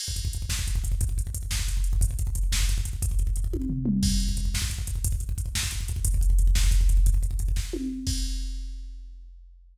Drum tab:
CC |x-----------|------------|------------|------------|
HH |--x-x---x-x-|x-x-x---x-x-|x-x-x---x-x-|x-x-x-------|
SD |------o-----|------o-----|------o-----|------------|
T1 |------------|------------|------------|------o-----|
T2 |------------|------------|------------|----------o-|
FT |------------|------------|------------|--------o---|
BD |-ooooooooooo|oooooooooo-o|oooooooooooo|oooooooo----|

CC |x-----------|------------|------------|------------|
HH |--x-x---x-x-|x-x-x---x-x-|x-x-x---x-x-|x-x-x-------|
SD |------o-----|------o-----|------o-----|------o-----|
T1 |------------|------------|------------|--------o---|
T2 |------------|------------|------------|------------|
FT |------------|------------|------------|------------|
BD |oo-ooooooooo|oooooooooooo|oooooooooooo|ooooooo-----|

CC |x-----------|
HH |------------|
SD |------------|
T1 |------------|
T2 |------------|
FT |------------|
BD |o-----------|